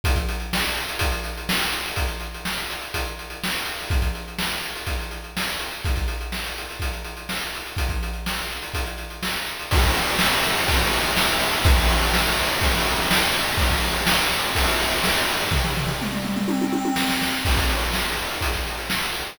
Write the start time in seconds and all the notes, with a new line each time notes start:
0.04 kick, closed hi-hat
0.15 kick, closed hi-hat
0.29 closed hi-hat
0.40 closed hi-hat
0.53 snare
0.64 closed hi-hat
0.77 closed hi-hat
0.89 closed hi-hat
0.99 kick, closed hi-hat
1.12 closed hi-hat
1.24 closed hi-hat
1.38 closed hi-hat
1.49 snare
1.61 closed hi-hat
1.72 closed hi-hat
1.86 closed hi-hat
1.96 kick, closed hi-hat
2.08 closed hi-hat
2.20 closed hi-hat
2.34 closed hi-hat
2.45 snare
2.58 closed hi-hat
2.70 closed hi-hat
2.82 closed hi-hat
2.94 kick, closed hi-hat
3.06 closed hi-hat
3.19 closed hi-hat
3.30 closed hi-hat
3.44 snare
3.54 closed hi-hat
3.65 closed hi-hat
3.79 open hi-hat
3.90 kick, closed hi-hat
4.02 kick, closed hi-hat
4.15 closed hi-hat
4.28 closed hi-hat
4.39 snare
4.52 closed hi-hat
4.64 closed hi-hat
4.75 closed hi-hat
4.87 kick, closed hi-hat
5.00 closed hi-hat
5.11 closed hi-hat
5.24 closed hi-hat
5.37 snare
5.48 closed hi-hat
5.59 closed hi-hat
5.72 closed hi-hat
5.85 kick, closed hi-hat
5.96 kick, closed hi-hat
6.08 closed hi-hat
6.21 closed hi-hat
6.32 snare
6.46 closed hi-hat
6.58 closed hi-hat
6.70 closed hi-hat
6.80 kick, closed hi-hat
6.93 closed hi-hat
7.04 closed hi-hat
7.17 closed hi-hat
7.29 snare
7.41 closed hi-hat
7.54 closed hi-hat
7.66 closed hi-hat
7.77 kick, closed hi-hat
7.89 kick, closed hi-hat
8.03 closed hi-hat
8.13 closed hi-hat
8.26 snare
8.38 closed hi-hat
8.51 closed hi-hat
8.62 closed hi-hat
8.74 kick, closed hi-hat
8.86 closed hi-hat
8.98 closed hi-hat
9.10 closed hi-hat
9.23 snare
9.36 closed hi-hat
9.46 closed hi-hat
9.59 closed hi-hat
9.71 kick, crash
9.84 kick, ride
9.94 ride
10.07 ride
10.19 snare
10.32 ride
10.43 ride
10.57 ride
10.68 kick, ride
10.81 ride
10.94 ride
11.04 ride
11.17 snare
11.28 ride
11.40 ride
11.52 ride
11.64 kick, ride
11.77 kick, ride
11.88 ride
12.01 ride
12.14 snare
12.27 ride
12.38 ride
12.49 ride
12.61 kick, ride
12.74 ride
12.86 ride
12.98 ride
13.11 snare
13.23 ride
13.34 ride
13.46 ride
13.58 kick, ride
13.70 kick, ride
13.83 ride
13.95 ride
14.07 snare
14.19 ride
14.32 ride
14.43 ride
14.55 kick, ride
14.67 ride
14.81 ride
14.91 ride
15.04 snare
15.14 ride
15.29 ride
15.40 ride
15.51 kick, floor tom
15.64 floor tom
15.77 floor tom
15.87 floor tom
16.02 mid tom
16.12 mid tom
16.25 mid tom
16.36 mid tom
16.48 high tom
16.61 high tom
16.73 high tom
16.85 high tom
16.96 snare
17.10 snare
17.22 snare
17.45 kick, crash
17.57 kick, closed hi-hat
17.70 closed hi-hat
17.81 closed hi-hat
17.93 snare
18.05 closed hi-hat
18.19 closed hi-hat
18.31 closed hi-hat
18.41 kick, closed hi-hat
18.54 kick, closed hi-hat
18.67 closed hi-hat
18.78 closed hi-hat
18.90 snare
19.02 closed hi-hat
19.14 closed hi-hat
19.26 closed hi-hat